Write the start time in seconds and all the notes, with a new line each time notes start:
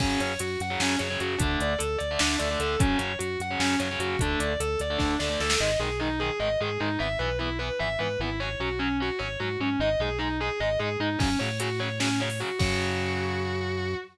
0.00 F#2 C#3 F#3 C#4, kick, crash
0.20 F#2 C#5, closed hi-hat
0.39 F#2 F#4, closed hi-hat
0.60 F#2 F#5, closed hi-hat
0.70 C#3 F#3
0.80 F#2 C#4, snare
0.99 F#2 C#3 F#3 C#5, closed hi-hat
1.10 C#3 F#3
1.20 F#2 F#4, closed hi-hat
1.38 D2 D3 A3 D4, kick, closed hi-hat
1.60 D2 D5, closed hi-hat
1.78 D2 A4, closed hi-hat
1.98 D2 D5, closed hi-hat
2.11 D3 A3
2.19 D2 D4, snare
2.39 D2 D3 A3 D5, closed hi-hat
2.51 D3 A3
2.60 D2 A4, closed hi-hat
2.79 F#2 C#3 F#3 C#4, kick, closed hi-hat
2.98 F#2 C#5, closed hi-hat
3.19 F#2 F#4, closed hi-hat
3.40 F#2 F#5, closed hi-hat
3.51 C#3 F#3
3.60 F#2 C#4, snare
3.79 F#2 C#3 F#3 C#5, closed hi-hat
3.91 C#3 F#3
3.99 F#2 F#4, closed hi-hat
4.19 D2 D3 A3 D4, kick, closed hi-hat
4.40 D2 D5, closed hi-hat
4.60 D2 A4, closed hi-hat
4.79 D2 D5, closed hi-hat
4.90 D3 A3
4.98 D2 D4, kick, snare
5.19 D2 D3 A3 D5, snare
5.29 D3 A3
5.40 D2 A4, snare
5.50 snare
5.60 G#1 D#3 G#3 D#5
5.79 B1 D#3 G#3 G#4
6.00 D#3 G#3 D#4
6.20 D#3 G#3 G#4
6.40 G#1 D#3 G#3 D#5
6.61 G#2 D#3 G#3 G#4
6.80 G#2 D#3 G#3 D#4
6.99 G#1 E3 B3 E5
7.19 B1 E3 B3 B4
7.39 E3 B3 E4
7.59 E3 B3 B4
7.79 G#1 E3 B3 E5
7.99 G#2 E3 B3 B4
8.19 G#1 E3 B3 E4
8.40 F#3 C#4 C#5
8.60 B1 F#3 C#4 F#4
8.79 F#3 C#4
9.00 F#3 C#4 F#4
9.19 G#1 F#3 C#4 C#5
9.40 G#2 F#3 C#4 F#4
9.60 G#2 F#3 C#4
9.79 G#1 G#3 D#4 D#5
9.99 B1 G#3 D#4 G#4
10.19 G#3 D#4
10.40 G#3 D#4 G#4
10.60 G#1 G#3 D#4 D#5
10.79 G#2 G#3 D#4 G#4
11.00 G#2 G#3 D#4
11.19 F#2 C#3 F#3 C#4, kick, crash
11.39 A2 C#3 F#3 C#5
11.60 C#3 F#3 F#4, closed hi-hat
11.79 C#3 F#3 C#5
12.00 C#3 F#3 C#4, snare
12.20 C#3 F#3 C#5
12.30 open hi-hat
12.40 C#3 F#3 F#4
12.59 F#2 C#3 F#3 F#4, kick, crash